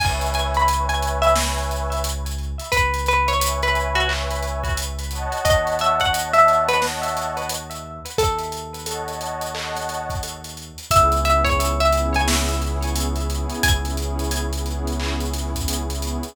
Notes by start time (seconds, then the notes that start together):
0.00 C#2 B4 C#5 E5 G#5, kick, crash
0.21 closed hi-hat
0.34 G#5, closed hi-hat
0.54 B5, closed hi-hat
0.68 B4 C#5 E5 G#5, closed hi-hat
0.89 B4 C#5 E5 G#5, closed hi-hat
1.02 closed hi-hat
1.22 E5, closed hi-hat
1.36 B4 C#5 E5 G#5, snare
1.58 closed hi-hat
1.71 closed hi-hat
1.92 closed hi-hat
2.04 closed hi-hat
2.26 closed hi-hat
2.38 closed hi-hat
2.59 closed hi-hat
2.72 C#2 B4, kick, closed hi-hat
2.94 closed hi-hat
3.06 B4, closed hi-hat
3.28 C#5, closed hi-hat
3.41 B4 C#5 E5 G#5, closed hi-hat
3.62 B4 C#5 E5 G#5, closed hi-hat
3.75 closed hi-hat
3.95 F#4, closed hi-hat
4.09 B4 C#5 E5 G#5, clap
4.31 closed hi-hat
4.42 closed hi-hat
4.64 kick, closed hi-hat
4.77 closed hi-hat
4.99 closed hi-hat
5.11 C#5 D#5 F#5 A5, closed hi-hat
5.32 closed hi-hat
5.45 D#2 D#5, kick, closed hi-hat
5.67 closed hi-hat
5.79 E5, closed hi-hat
6.00 F#5, kick, closed hi-hat
6.14 C#5 D#5 F#5 A5, closed hi-hat
6.33 C#5 D#5 E5 F#5 A5, closed hi-hat
6.48 closed hi-hat
6.68 B4, closed hi-hat
6.82 C#5 D#5 F#5 A5, snare
7.03 closed hi-hat
7.17 closed hi-hat
7.37 closed hi-hat
7.49 closed hi-hat
7.71 closed hi-hat
8.06 closed hi-hat
8.18 D#2 A4, kick, closed hi-hat
8.38 closed hi-hat
8.52 closed hi-hat
8.74 closed hi-hat
8.86 C#5 D#5 F#5 A5, closed hi-hat
9.07 C#5 D#5 F#5 A5, closed hi-hat
9.21 closed hi-hat
9.41 closed hi-hat
9.54 C#5 D#5 F#5 A5, clap
9.75 snare, closed hi-hat
9.89 closed hi-hat
10.10 kick, closed hi-hat
10.23 closed hi-hat
10.44 closed hi-hat
10.57 closed hi-hat
10.78 closed hi-hat
10.91 C#2 B3 C#4 E4 G#4 E5, kick, closed hi-hat
11.12 B3 C#4 E4 G#4, closed hi-hat
11.25 B3 C#4 E4 G#4 E5, closed hi-hat
11.44 C#5, kick, closed hi-hat
11.60 closed hi-hat
11.80 B3 C#4 E4 G#4 E5, closed hi-hat
11.92 B3 C#4 E4 G#4, closed hi-hat
12.14 G#5, closed hi-hat
12.28 snare
12.48 closed hi-hat
12.61 B3 C#4 E4 G#4, closed hi-hat
12.82 B3 C#4 E4 G#4, closed hi-hat
12.95 closed hi-hat
13.16 B3 C#4 E4 G#4, closed hi-hat
13.30 B3 C#4 E4 G#4, closed hi-hat
13.50 closed hi-hat
13.63 C#2 G#5, kick, closed hi-hat
13.84 B3 C#4 E4 G#4, closed hi-hat
13.97 B3 C#4 E4 G#4, closed hi-hat
14.19 closed hi-hat
14.31 closed hi-hat
14.53 B3 C#4 E4 G#4, closed hi-hat
14.66 B3 C#4 E4 G#4, closed hi-hat
14.87 closed hi-hat
15.00 clap
15.20 closed hi-hat
15.34 B3 C#4 E4 G#4, snare, closed hi-hat
15.55 B3 C#4 E4 G#4, kick, closed hi-hat
15.68 closed hi-hat
15.90 B3 C#4 E4 G#4, closed hi-hat
16.02 B3 C#4 E4 G#4, closed hi-hat
16.23 closed hi-hat